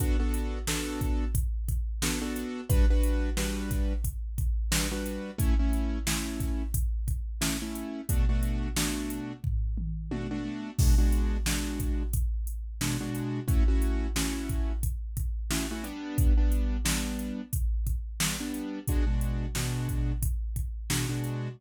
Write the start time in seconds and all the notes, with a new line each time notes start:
0.00 B3 D4 F#4 A4, kick, closed hi-hat
0.20 B3 D4 F#4 A4
0.34 closed hi-hat
0.67 B3 D4 F#4 A4, snare
1.01 kick, closed hi-hat
1.35 kick, closed hi-hat
1.69 kick, closed hi-hat
2.02 B3 D4 F#4 A4, snare
2.22 B3 D4 F#4 A4
2.36 closed hi-hat
2.70 G3 D4 F#4 B4, kick, closed hi-hat
2.90 G3 D4 F#4 B4
3.03 closed hi-hat
3.37 G3 D4 F#4 B4, snare
3.71 kick, snare, closed hi-hat
4.04 kick, closed hi-hat
4.38 kick, closed hi-hat
4.72 G3 D4 F#4 B4, snare
4.92 G3 D4 F#4 B4
5.06 closed hi-hat
5.38 A3 C#4 E4, kick, closed hi-hat
5.59 A3 C#4 E4
5.73 closed hi-hat
6.07 A3 C#4 E4, snare
6.40 kick, snare, closed hi-hat
6.74 kick, closed hi-hat
7.08 kick, closed hi-hat
7.41 A3 C#4 E4, snare
7.62 A3 C#4 E4
7.75 closed hi-hat
8.09 B2 A3 D4 F#4, kick, closed hi-hat
8.29 B2 A3 D4 F#4
8.43 closed hi-hat
8.77 B2 A3 D4 F#4, snare
9.10 closed hi-hat
9.44 kick, floor tom
9.78 mid tom
10.11 B2 A3 D4 F#4, high tom
10.31 B2 A3 D4 F#4
10.79 B2 G#3 D4 F#4, kick, crash
10.98 B2 G#3 D4 F#4
11.12 closed hi-hat
11.46 B2 G#3 D4 F#4, snare
11.80 kick, closed hi-hat
12.13 kick, closed hi-hat
12.47 closed hi-hat
12.81 B2 G#3 D4 F#4, snare
13.01 B2 G#3 D4 F#4
13.14 closed hi-hat
13.48 A3 C#4 E4 F#4, kick, closed hi-hat
13.68 A3 C#4 E4 F#4
13.82 closed hi-hat
14.16 A3 C#4 E4 F#4, snare
14.49 kick, closed hi-hat
14.83 kick, closed hi-hat
15.17 kick, closed hi-hat
15.51 A3 C#4 E4 F#4, snare
15.71 A3 C#4 E4 F#4
15.84 G3 B3 D4, closed hi-hat
16.18 kick, closed hi-hat
16.37 G3 B3 D4
16.52 closed hi-hat
16.85 G3 B3 D4, snare
17.19 closed hi-hat
17.53 kick, closed hi-hat
17.87 kick, closed hi-hat
18.20 G3 B3 D4, snare
18.40 G3 B3 D4
18.54 closed hi-hat
18.87 B2 G#3 D4 F#4, kick, closed hi-hat
19.07 B2 G#3 D4 F#4
19.21 closed hi-hat
19.55 B2 G#3 D4 F#4, snare
19.89 kick, closed hi-hat
20.22 kick, closed hi-hat
20.56 kick, closed hi-hat
20.90 B2 G#3 D4 F#4, snare
21.09 B2 G#3 D4 F#4
21.24 closed hi-hat